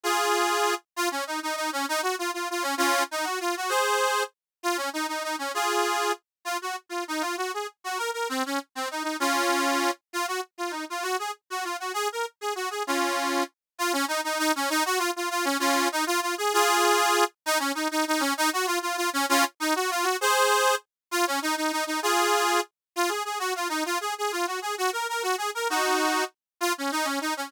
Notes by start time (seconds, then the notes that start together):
0.03 F4 G#4
0.96 F4
1.11 C#4
1.27 D#4
1.43 D#4
1.56 D#4
1.73 C#4
1.89 D#4
2.03 F#4
2.19 F4
2.34 F4
2.51 F4
2.62 C#4
2.78 C#4 F4
3.11 D#4
3.24 F#4
3.40 F4
3.57 F#4
3.69 G#4 C5
4.63 F4
4.77 C#4
4.93 D#4
5.08 D#4
5.24 D#4
5.39 C#4
5.54 F4 G#4
6.45 F4
6.62 F#4
6.89 F4
7.08 D#4
7.21 F4
7.37 F#4
7.54 G#4
7.84 F#4
7.98 A#4
8.13 A#4
8.29 C4
8.46 C#4
8.75 C4
8.91 D#4
9.03 D#4
9.20 C#4 F4
10.13 F4
10.28 F#4
10.58 F4
10.71 D#4
10.90 F4
11.03 F#4
11.19 G#4
11.50 F#4
11.64 F4
11.80 F#4
11.94 G#4
12.12 A#4
12.41 G#4
12.56 F#4
12.71 G#4
12.87 C#4 F4
13.79 F4
13.93 C#4
14.08 D#4
14.24 D#4
14.39 D#4
14.56 C#4
14.70 D#4
14.85 F#4
14.98 F4
15.16 F4
15.30 F4
15.45 C#4
15.60 C#4 F4
15.92 D#4
16.07 F4
16.22 F4
16.38 G#4
16.53 F4 G#4
17.46 D#4
17.59 C#4
17.75 D#4
17.91 D#4
18.08 D#4
18.20 C#4
18.37 D#4
18.53 F#4
18.67 F4
18.82 F4
18.97 F4
19.13 C#4
19.29 C#4 F4
19.60 D#4
19.76 F#4
19.91 F4
20.03 F#4
20.21 G#4 C5
21.11 F4
21.27 C#4
21.42 D#4
21.57 D#4
21.72 D#4
21.87 D#4
22.03 F4 G#4
22.96 F4
23.09 G#4
23.25 G#4
23.39 F#4
23.56 F4
23.69 D#4
23.86 F4
24.01 G#4
24.18 G#4
24.32 F4
24.47 F#4
24.62 G#4
24.78 F#4
24.93 A#4
25.09 A#4
25.23 F#4
25.38 G#4
25.55 A#4
25.70 D#4 F#4
26.61 F4
26.78 C#4
26.92 D#4
27.05 C#4
27.21 D#4
27.37 C#4